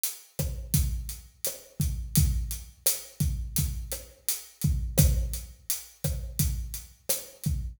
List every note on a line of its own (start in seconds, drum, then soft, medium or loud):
0.04 closed hi-hat medium
0.39 kick medium
0.39 cross-stick medium
0.39 closed hi-hat medium
0.74 kick medium
0.74 closed hi-hat medium
1.09 closed hi-hat medium
1.45 cross-stick medium
1.45 closed hi-hat medium
1.80 kick medium
1.80 closed hi-hat medium
2.15 kick medium
2.15 closed hi-hat medium
2.51 closed hi-hat medium
2.86 cross-stick medium
2.86 closed hi-hat loud
3.20 kick medium
3.20 closed hi-hat medium
3.56 kick medium
3.56 closed hi-hat medium
3.92 cross-stick medium
3.92 closed hi-hat medium
4.29 closed hi-hat medium
4.61 kick medium
4.61 closed hi-hat medium
4.98 kick medium
4.98 cross-stick medium
4.98 closed hi-hat loud
5.34 closed hi-hat medium
5.70 closed hi-hat medium
6.04 kick medium
6.04 cross-stick medium
6.04 closed hi-hat medium
6.39 kick medium
6.39 closed hi-hat medium
6.74 closed hi-hat medium
7.09 cross-stick medium
7.09 closed hi-hat medium
7.44 kick medium
7.44 closed hi-hat medium